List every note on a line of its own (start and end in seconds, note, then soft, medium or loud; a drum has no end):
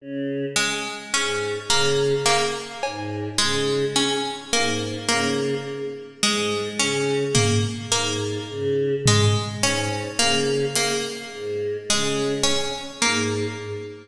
0.00 0.45 C#3 medium
0.56 1.01 G#3 medium
1.13 1.58 G#2 medium
1.13 1.59 C#4 medium
1.69 2.14 C#3 medium
1.69 2.15 A#3 medium
2.26 2.71 A#3 medium
2.26 clap medium
2.83 3.29 G#2 medium
2.83 cowbell medium
3.38 3.85 C#3 medium
3.38 3.83 G#3 medium
3.96 4.41 C#4 medium
4.53 4.98 G#2 medium
4.53 4.98 A#3 medium
5.08 5.54 C#3 medium
5.08 5.54 A#3 medium
6.23 6.68 G#2 medium
6.23 6.68 G#3 medium
6.79 7.24 C#3 medium
6.79 7.25 C#4 medium
7.35 7.80 A#3 medium
7.35 floor tom medium
7.92 8.38 G#2 medium
7.92 8.37 A#3 medium
8.50 8.95 C#3 medium
9.06 9.53 G#3 medium
9.06 floor tom medium
9.62 10.08 G#2 medium
9.62 10.08 C#4 medium
10.19 10.65 C#3 medium
10.19 10.64 A#3 medium
10.75 11.21 A#3 medium
10.75 closed hi-hat loud
11.32 11.77 G#2 medium
11.89 12.34 C#3 medium
11.89 12.35 G#3 medium
12.43 12.89 C#4 medium
13.01 13.46 G#2 medium
13.01 13.47 A#3 medium